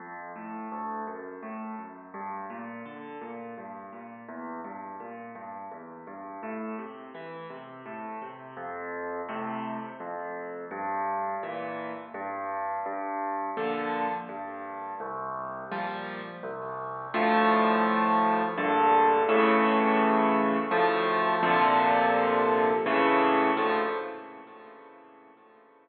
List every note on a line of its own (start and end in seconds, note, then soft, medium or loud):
0.00 0.32 F2 medium
0.36 0.68 A2 medium
0.72 1.04 D2 medium
1.07 1.39 F#2 medium
1.43 1.75 A2 medium
1.78 2.10 F#2 soft
2.14 2.46 G2 medium
2.50 2.82 A#2 medium
2.85 3.18 D3 medium
3.21 3.54 A#2 medium
3.58 3.90 G2 medium
3.93 4.25 A#2 medium
4.29 4.61 E2 medium
4.64 4.97 G2 medium
5.00 5.32 A#2 medium
5.35 5.67 G2 medium
5.71 6.04 E2 medium
6.07 6.39 G2 medium
6.43 6.75 A2 medium
6.79 7.11 C3 medium
7.15 7.47 E3 medium
7.50 7.82 C3 medium
7.86 8.18 A2 medium
8.22 8.54 C3 medium
8.57 9.21 F2 medium
9.29 9.79 A2 medium
9.29 9.79 C3 medium
10.00 10.64 F2 medium
10.71 11.35 G2 loud
11.43 11.93 A#2 medium
11.43 11.93 E3 medium
12.14 12.79 G2 loud
12.86 13.50 G2 medium
13.57 14.07 A#2 medium
13.57 14.07 D3 medium
13.57 14.07 F3 medium
14.29 14.93 G2 medium
15.00 15.64 C2 loud
15.71 16.21 A#2 medium
15.71 16.21 F3 medium
15.71 16.21 G3 medium
16.43 17.07 C2 loud
17.14 18.43 D2 loud
17.14 18.43 A2 loud
17.14 18.43 F3 loud
18.58 19.22 A#1 loud
18.58 19.22 G2 loud
18.58 19.22 D3 loud
19.29 20.57 A2 loud
19.29 20.57 C#3 loud
19.29 20.57 E3 loud
20.71 21.35 D2 loud
20.71 21.35 A2 loud
20.71 21.35 F3 loud
21.43 22.71 A#2 loud
21.43 22.71 C3 loud
21.43 22.71 D3 loud
21.43 22.71 F3 loud
22.86 23.50 A2 loud
22.86 23.50 C#3 loud
22.86 23.50 E3 loud
23.57 23.82 D2 loud
23.57 23.82 A2 loud
23.57 23.82 F3 loud